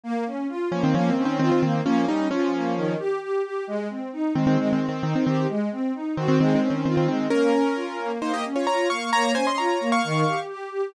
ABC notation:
X:1
M:4/4
L:1/16
Q:1/4=132
K:Ab
V:1 name="Acoustic Grand Piano"
z6 [F,D] [E,C] (3[F,D]2 [E,C]2 [E,C]2 [E,C] [E,C] [E,C]2 | [F,D]2 [G,E]2 [F,D]6 z6 | z6 [E,C] [E,C] (3[E,C]2 [E,C]2 [E,C]2 [E,C] [E,C] [E,C]2 | z6 [E,C] [E,C] (3[E,C]2 [E,C]2 [E,C]2 [E,C] [E,C] [E,C]2 |
[DB]8 [Ec] [Ge] z [Fd] [db]2 [fd']2 | [db]2 [ca] [ec'] [db]3 [fd']5 z4 |]
V:2 name="String Ensemble 1"
B,2 D2 F2 B,2 B,2 D2 F2 B,2 | B,2 D2 F2 B,2 E,2 G2 G2 G2 | A,2 C2 E2 A,2 A,2 C2 E2 G2 | A,2 C2 E2 _G2 A,2 D2 F2 A,2 |
B,2 D2 F2 B,2 B,2 D2 F2 B,2 | B,2 D2 F2 B,2 E,2 G2 G2 G2 |]